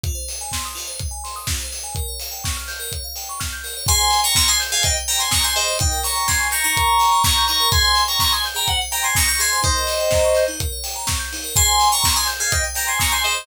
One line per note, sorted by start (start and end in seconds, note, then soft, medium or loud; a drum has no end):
0.04 0.14 F4 medium
0.04 kick loud
0.04 closed hi-hat medium
0.15 0.26 C5 medium
0.28 0.39 D#5 medium
0.28 open hi-hat medium
0.41 0.52 G#5 medium
0.52 0.63 C6 medium
0.52 kick medium
0.52 snare loud
0.65 0.76 D#6 medium
0.75 0.86 F4 medium
0.75 open hi-hat medium
0.87 0.98 C5 medium
0.99 1.11 D#5 medium
0.99 kick medium
0.99 closed hi-hat medium
1.11 1.22 G#5 medium
1.24 1.35 C6 medium
1.24 open hi-hat medium
1.36 1.47 D#6 medium
1.47 1.59 F4 medium
1.47 kick medium
1.47 snare loud
1.60 1.71 C5 medium
1.72 1.83 D#5 medium
1.72 open hi-hat medium
1.84 1.94 G#5 medium
1.95 2.07 A#4 medium
1.95 kick medium
1.95 closed hi-hat medium
2.08 2.19 C#5 medium
2.20 2.31 F5 medium
2.20 open hi-hat medium
2.31 2.42 G5 medium
2.44 2.55 C#6 medium
2.44 kick medium
2.44 snare medium
2.57 2.68 F6 medium
2.68 2.79 G6 medium
2.68 open hi-hat medium
2.80 2.90 A#4 medium
2.92 3.03 C#5 medium
2.92 kick medium
2.92 closed hi-hat medium
3.04 3.15 F5 medium
3.16 3.27 G5 medium
3.16 open hi-hat medium
3.29 3.40 C#6 medium
3.40 3.51 F6 medium
3.40 kick medium
3.40 snare medium
3.52 3.63 G6 medium
3.64 3.75 A#4 medium
3.64 open hi-hat medium
3.77 3.88 C#5 medium
3.87 4.00 G#4 medium
3.87 4.21 G#5 medium
3.87 4.21 C6 loud
3.87 kick loud
3.87 closed hi-hat loud
4.00 4.10 C5 medium
4.11 4.24 D#5 medium
4.11 open hi-hat medium
4.24 4.35 G5 medium
4.24 4.35 A#5 medium
4.24 4.35 C#6 medium
4.35 4.47 A#5 medium
4.35 4.47 C6 medium
4.35 4.47 C#6 medium
4.35 kick medium
4.35 snare loud
4.48 4.59 G#5 medium
4.48 4.59 C6 medium
4.48 4.60 D#6 medium
4.60 4.71 G6 medium
4.60 open hi-hat medium
4.72 4.83 G#4 medium
4.72 4.83 F5 medium
4.72 4.83 G#5 medium
4.83 4.94 C5 medium
4.83 4.95 D#5 medium
4.83 4.95 G5 medium
4.83 kick medium
4.83 closed hi-hat loud
4.97 5.08 D#5 medium
5.08 5.19 G5 medium
5.08 5.19 A#5 medium
5.08 open hi-hat medium
5.19 5.31 G#5 medium
5.19 5.30 C6 medium
5.19 5.31 C6 medium
5.31 5.43 A#5 medium
5.31 5.43 C#6 medium
5.31 5.42 D#6 medium
5.31 kick medium
5.31 snare loud
5.44 5.55 G#5 medium
5.44 5.55 C6 medium
5.44 5.54 G6 medium
5.56 5.66 G#4 medium
5.56 5.77 C5 medium
5.56 5.77 D#5 medium
5.56 open hi-hat medium
5.68 5.79 C5 medium
5.79 5.91 D#4 medium
5.79 5.99 D#5 medium
5.79 5.99 G5 medium
5.79 kick loud
5.79 closed hi-hat loud
5.91 6.02 A#4 medium
6.04 6.15 C#5 medium
6.04 6.27 A#5 medium
6.04 6.27 C#6 medium
6.04 open hi-hat medium
6.15 6.26 G5 medium
6.28 6.48 G#5 medium
6.28 6.39 A#5 medium
6.28 6.48 C6 medium
6.28 kick medium
6.28 snare loud
6.39 6.50 C#6 medium
6.51 6.63 A#5 medium
6.51 6.63 C#6 medium
6.51 6.63 G6 medium
6.51 open hi-hat medium
6.64 6.75 D#4 medium
6.64 7.23 A#5 medium
6.64 7.23 C#6 medium
6.77 6.87 A#4 medium
6.77 kick medium
6.77 closed hi-hat loud
6.87 6.98 C#5 medium
6.99 7.10 G5 medium
6.99 open hi-hat medium
7.12 7.23 A#5 medium
7.23 7.45 A#5 medium
7.23 7.34 C#6 medium
7.23 7.45 C#6 medium
7.23 kick loud
7.23 snare loud
7.37 7.48 G6 medium
7.47 7.60 D#4 medium
7.47 7.68 A#5 medium
7.47 7.68 C#6 medium
7.47 open hi-hat medium
7.60 7.71 A#4 medium
7.72 7.82 G#4 medium
7.72 8.03 G#5 medium
7.72 8.03 C6 loud
7.72 kick loud
7.72 closed hi-hat loud
7.84 7.95 C5 medium
7.95 8.06 D#5 medium
7.95 open hi-hat medium
8.08 8.19 G5 medium
8.08 8.19 A#5 medium
8.08 8.19 C#6 medium
8.20 8.31 A#5 medium
8.20 8.31 C6 medium
8.20 8.31 C#6 medium
8.20 kick medium
8.20 snare loud
8.32 8.43 G#5 medium
8.32 8.43 C6 medium
8.32 8.44 D#6 medium
8.44 8.56 G6 medium
8.44 open hi-hat medium
8.55 8.65 G#4 medium
8.55 8.67 G5 medium
8.55 8.67 A#5 medium
8.67 8.78 C5 medium
8.67 8.79 F#5 medium
8.67 kick medium
8.67 closed hi-hat medium
8.81 8.92 D#5 medium
8.91 9.02 G5 medium
8.91 9.03 G5 medium
8.91 9.03 A#5 medium
8.91 open hi-hat medium
9.03 9.15 G#5 medium
9.03 9.14 C6 medium
9.03 9.15 C6 medium
9.15 9.27 A#5 medium
9.15 9.27 C#6 medium
9.15 9.27 D#6 medium
9.15 kick medium
9.15 snare loud
9.28 9.39 A#5 medium
9.28 9.39 C#6 medium
9.28 9.38 G6 medium
9.39 9.50 G#4 medium
9.39 9.60 G#5 medium
9.39 9.60 C6 medium
9.39 open hi-hat medium
9.53 9.64 C5 medium
9.63 9.73 D#4 medium
9.63 10.44 C5 medium
9.63 10.44 D#5 loud
9.63 kick loud
9.63 closed hi-hat medium
9.76 9.87 A#4 medium
9.87 9.99 C#5 medium
9.87 open hi-hat medium
10.00 10.11 G5 medium
10.11 10.23 A#5 medium
10.11 kick medium
10.11 snare medium
10.25 10.35 C#6 medium
10.35 10.47 G6 medium
10.35 open hi-hat medium
10.48 10.59 D#4 medium
10.60 10.71 A#4 medium
10.60 kick medium
10.60 closed hi-hat loud
10.72 10.83 C#5 medium
10.84 10.95 G5 medium
10.84 open hi-hat medium
10.96 11.06 A#5 medium
11.07 11.18 C#6 medium
11.07 kick medium
11.07 snare loud
11.19 11.30 G6 medium
11.33 11.43 D#4 medium
11.33 open hi-hat medium
11.44 11.54 A#4 medium
11.55 11.66 G#4 medium
11.55 11.89 G#5 medium
11.55 11.89 C6 loud
11.55 kick loud
11.55 closed hi-hat loud
11.68 11.79 C5 medium
11.80 11.91 D#5 medium
11.80 open hi-hat medium
11.92 12.03 G5 medium
11.92 12.03 A#5 medium
11.92 12.03 C#6 medium
12.03 12.15 A#5 medium
12.03 12.14 C6 medium
12.03 12.15 C#6 medium
12.03 kick medium
12.03 snare loud
12.16 12.27 G#5 medium
12.16 12.27 C6 medium
12.16 12.27 D#6 medium
12.27 12.38 G6 medium
12.27 open hi-hat medium
12.40 12.51 G#4 medium
12.40 12.51 F5 medium
12.40 12.51 G#5 medium
12.51 12.61 C5 medium
12.51 12.63 D#5 medium
12.51 12.63 G5 medium
12.51 kick medium
12.51 closed hi-hat loud
12.64 12.75 D#5 medium
12.75 12.85 G5 medium
12.75 12.87 G5 medium
12.75 12.87 A#5 medium
12.75 open hi-hat medium
12.87 12.99 G#5 medium
12.87 12.98 C6 medium
12.87 12.99 C6 medium
12.99 13.11 A#5 medium
12.99 13.11 C#6 medium
12.99 13.10 D#6 medium
12.99 kick medium
12.99 snare loud
13.12 13.23 G#5 medium
13.12 13.23 C6 medium
13.12 13.23 G6 medium
13.24 13.36 G#4 medium
13.24 13.45 C5 medium
13.24 13.45 D#5 medium
13.24 open hi-hat medium
13.35 13.46 C5 medium